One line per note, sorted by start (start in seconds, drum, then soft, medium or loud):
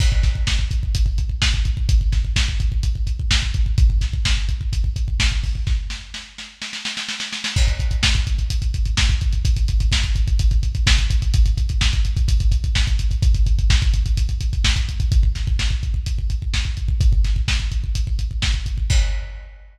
0.00 kick loud
0.00 crash loud
0.12 kick medium
0.23 kick medium
0.23 snare medium
0.23 closed hi-hat medium
0.35 kick medium
0.47 kick medium
0.47 snare loud
0.59 kick medium
0.71 kick medium
0.71 closed hi-hat medium
0.83 kick medium
0.95 kick medium
0.95 closed hi-hat loud
1.06 kick medium
1.18 kick medium
1.18 closed hi-hat medium
1.29 kick medium
1.42 kick medium
1.42 snare loud
1.54 kick medium
1.65 kick medium
1.65 closed hi-hat medium
1.77 kick medium
1.89 kick loud
1.89 closed hi-hat loud
2.01 kick medium
2.12 kick medium
2.12 snare medium
2.12 closed hi-hat medium
2.25 kick medium
2.36 kick medium
2.36 snare loud
2.48 kick medium
2.60 kick medium
2.60 closed hi-hat medium
2.72 kick medium
2.83 kick medium
2.83 closed hi-hat medium
2.95 kick medium
3.07 kick medium
3.07 closed hi-hat medium
3.19 kick medium
3.31 kick medium
3.31 snare loud
3.42 kick medium
3.54 kick medium
3.54 closed hi-hat medium
3.66 kick medium
3.78 kick loud
3.78 closed hi-hat medium
3.90 kick medium
4.01 kick medium
4.01 snare medium
4.01 closed hi-hat medium
4.13 kick medium
4.25 kick medium
4.25 snare loud
4.37 kick medium
4.49 kick medium
4.49 closed hi-hat medium
4.61 kick medium
4.73 kick medium
4.73 closed hi-hat medium
4.84 kick medium
4.96 kick medium
4.96 closed hi-hat medium
5.08 kick medium
5.20 kick medium
5.20 snare loud
5.32 kick medium
5.44 kick medium
5.44 open hi-hat medium
5.55 kick medium
5.67 kick medium
5.67 snare medium
5.90 snare medium
6.14 snare medium
6.38 snare medium
6.62 snare medium
6.73 snare medium
6.85 snare medium
6.97 snare medium
7.09 snare medium
7.20 snare medium
7.32 snare medium
7.44 snare loud
7.56 kick loud
7.56 crash loud
7.67 kick medium
7.67 closed hi-hat medium
7.80 kick medium
7.80 closed hi-hat medium
7.91 kick medium
7.91 closed hi-hat medium
8.03 kick medium
8.03 snare loud
8.15 kick medium
8.15 closed hi-hat medium
8.27 kick medium
8.27 closed hi-hat medium
8.38 kick medium
8.38 closed hi-hat medium
8.50 kick medium
8.50 closed hi-hat loud
8.62 kick medium
8.62 closed hi-hat medium
8.74 kick medium
8.74 closed hi-hat medium
8.85 kick medium
8.85 closed hi-hat medium
8.97 kick medium
8.97 snare loud
9.09 kick medium
9.09 closed hi-hat medium
9.21 kick medium
9.21 closed hi-hat medium
9.33 kick medium
9.33 closed hi-hat medium
9.45 kick loud
9.45 closed hi-hat loud
9.56 kick medium
9.56 closed hi-hat medium
9.68 kick medium
9.68 closed hi-hat medium
9.80 kick medium
9.80 closed hi-hat medium
9.92 kick medium
9.92 snare loud
10.03 kick medium
10.03 closed hi-hat medium
10.15 kick medium
10.15 closed hi-hat medium
10.28 kick medium
10.28 closed hi-hat medium
10.39 kick loud
10.39 closed hi-hat loud
10.51 kick medium
10.51 closed hi-hat medium
10.63 kick medium
10.63 closed hi-hat medium
10.75 kick medium
10.75 closed hi-hat medium
10.87 kick loud
10.87 snare loud
10.98 kick medium
10.98 closed hi-hat medium
11.10 kick medium
11.10 closed hi-hat medium
11.22 kick medium
11.22 closed hi-hat medium
11.34 kick loud
11.34 closed hi-hat loud
11.46 kick medium
11.46 closed hi-hat medium
11.57 kick medium
11.57 closed hi-hat medium
11.69 kick medium
11.69 closed hi-hat medium
11.81 kick medium
11.81 snare loud
11.93 kick medium
11.93 closed hi-hat medium
12.05 kick medium
12.05 closed hi-hat medium
12.17 kick loud
12.17 closed hi-hat medium
12.28 kick loud
12.28 closed hi-hat loud
12.40 kick medium
12.40 closed hi-hat medium
12.52 kick medium
12.52 closed hi-hat medium
12.64 kick medium
12.64 closed hi-hat medium
12.75 kick medium
12.75 snare loud
12.87 kick medium
12.87 closed hi-hat medium
12.99 kick medium
12.99 closed hi-hat medium
13.11 kick medium
13.11 closed hi-hat medium
13.22 kick loud
13.22 closed hi-hat loud
13.34 kick medium
13.34 closed hi-hat medium
13.46 kick medium
13.46 closed hi-hat medium
13.59 kick medium
13.59 closed hi-hat medium
13.70 kick loud
13.70 snare loud
13.82 kick loud
13.82 closed hi-hat medium
13.94 kick medium
13.94 closed hi-hat medium
14.06 kick medium
14.06 closed hi-hat medium
14.17 kick medium
14.17 closed hi-hat loud
14.29 kick medium
14.29 closed hi-hat medium
14.41 kick medium
14.41 closed hi-hat medium
14.53 kick medium
14.53 closed hi-hat medium
14.64 kick medium
14.64 snare loud
14.76 kick medium
14.76 closed hi-hat medium
14.89 kick medium
14.89 closed hi-hat medium
15.00 kick medium
15.00 closed hi-hat medium
15.12 kick loud
15.12 closed hi-hat medium
15.23 kick medium
15.35 kick medium
15.35 snare medium
15.35 closed hi-hat medium
15.47 kick medium
15.59 kick medium
15.59 snare medium
15.70 kick medium
15.83 kick medium
15.83 closed hi-hat medium
15.94 kick medium
16.06 kick medium
16.06 closed hi-hat medium
16.19 kick medium
16.30 kick medium
16.30 closed hi-hat medium
16.42 kick medium
16.54 kick medium
16.54 snare medium
16.65 kick medium
16.77 kick medium
16.77 closed hi-hat medium
16.88 kick medium
17.01 kick loud
17.01 closed hi-hat medium
17.13 kick medium
17.25 kick medium
17.25 snare medium
17.25 closed hi-hat medium
17.36 kick medium
17.48 kick medium
17.48 snare loud
17.60 kick medium
17.72 kick medium
17.72 closed hi-hat medium
17.84 kick medium
17.95 kick medium
17.95 closed hi-hat loud
18.07 kick medium
18.19 kick medium
18.19 closed hi-hat medium
18.31 kick medium
18.42 kick medium
18.42 snare loud
18.54 kick medium
18.66 kick medium
18.66 closed hi-hat medium
18.78 kick medium
18.90 kick loud
18.90 crash loud